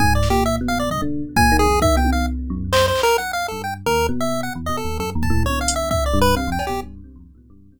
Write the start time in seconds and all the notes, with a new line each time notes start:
0.00 G#2 G#5, kick
0.15 D5
0.23 snare
0.30 A#2 G4
0.46 E5
0.61 B2
0.68 F5
0.79 D5
0.90 G2 D#5, floor tom
1.02 D3
1.36 A#2 G#5, kick
1.52 D#3
1.59 G#4
1.66 F2
1.82 D#3 E5, kick
1.96 B2 G5
2.05 high tom
2.12 D#3 F5
2.50 F#2
2.73 C5, clap
2.88 C5
2.95 clap
3.03 A#4
3.18 F#5
3.33 F5
3.48 G2 A4
3.64 G5
3.86 D#2 A#4
4.09 B2
4.21 E5
4.43 F#5
4.55 E2
4.66 B2 D#5
4.77 A4
4.85 D#2
4.99 F#2 A4
5.15 D#2
5.23 A5, kick
5.30 A2
5.44 D3 C#5, high tom
5.61 F5
5.68 closed hi-hat
5.76 E5
5.91 E5, kick
6.06 D5
6.14 G2
6.21 B4
6.36 C3 F5
6.47 F2
6.52 G5
6.59 cowbell
6.67 B2 G4